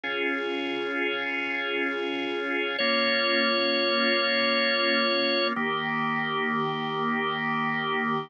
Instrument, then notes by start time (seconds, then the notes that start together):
drawbar organ
0.04 C#4 F4 G#4
2.78 A#3 C#4 F4 C#5
5.56 D#3 A#3 G4